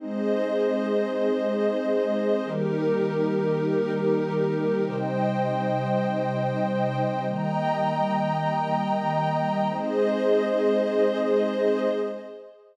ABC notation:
X:1
M:4/4
L:1/8
Q:1/4=99
K:Ab
V:1 name="Pad 2 (warm)"
[A,CE]8 | [E,G,B,]8 | [C,G,E]8 | [E,G,B,]8 |
[A,CE]8 |]
V:2 name="Pad 5 (bowed)"
[Ace]8 | [EGB]8 | [ceg]8 | [egb]8 |
[Ace]8 |]